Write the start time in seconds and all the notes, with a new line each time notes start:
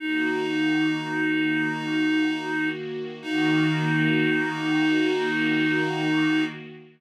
0.00 D#3 A#3 D#4 F#4
3.22 D#3 A#3 D#4 F#4